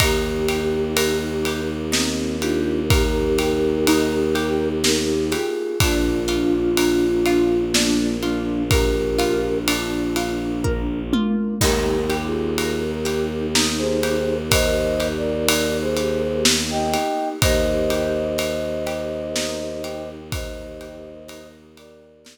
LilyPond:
<<
  \new Staff \with { instrumentName = "Flute" } { \time 3/4 \key ees \major \tempo 4 = 62 <ees' g'>2 <c' ees'>8 <d' f'>8 | <g' bes'>2 <ees' g'>8 <f' aes'>8 | <d' f'>2 <bes d'>8 <bes d'>8 | <g' bes'>4 r2 |
\tuplet 3/2 { <g' bes'>4 <f' aes'>4 <g' bes'>4 } r16 <aes' c''>8. | \tuplet 3/2 { <c'' ees''>4 <bes' d''>4 <aes' c''>4 } r16 <ees'' g''>8. | <c'' ees''>2. | <c'' ees''>4. <bes' d''>4 r8 | }
  \new Staff \with { instrumentName = "Pizzicato Strings" } { \time 3/4 \key ees \major ees'8 g'8 bes'8 g'8 ees'8 g'8 | bes'8 g'8 ees'8 g'8 bes'8 g'8 | d'8 f'8 bes'8 f'8 d'8 f'8 | bes'8 f'8 d'8 f'8 bes'8 f'8 |
ees'8 g'8 bes'8 g'8 ees'8 g'8 | bes'8 g'8 ees'8 g'8 bes'8 g'8 | ees'8 g'8 bes'8 g'8 ees'8 g'8 | bes'8 g'8 ees'8 g'8 bes'8 r8 | }
  \new Staff \with { instrumentName = "Violin" } { \clef bass \time 3/4 \key ees \major ees,2.~ | ees,2. | bes,,2.~ | bes,,2. |
ees,2.~ | ees,2. | ees,2.~ | ees,2. | }
  \new Staff \with { instrumentName = "Choir Aahs" } { \time 3/4 \key ees \major <bes ees' g'>2.~ | <bes ees' g'>2. | <bes d' f'>2.~ | <bes d' f'>2. |
<bes ees' g'>2.~ | <bes ees' g'>2. | <bes ees' g'>2.~ | <bes ees' g'>2. | }
  \new DrumStaff \with { instrumentName = "Drums" } \drummode { \time 3/4 <bd cymr>8 cymr8 cymr8 cymr8 sn8 cymr8 | <bd cymr>8 cymr8 cymr8 cymr8 sn8 cymr8 | <bd cymr>8 cymr8 cymr8 cymr8 sn8 cymr8 | <bd cymr>8 cymr8 cymr8 cymr8 bd8 tommh8 |
<cymc bd>8 cymr8 cymr8 cymr8 sn8 cymr8 | <bd cymr>8 cymr8 cymr8 cymr8 sn8 cymr8 | <bd cymr>8 cymr8 cymr8 cymr8 sn8 cymr8 | <bd cymr>8 cymr8 cymr8 cymr8 sn4 | }
>>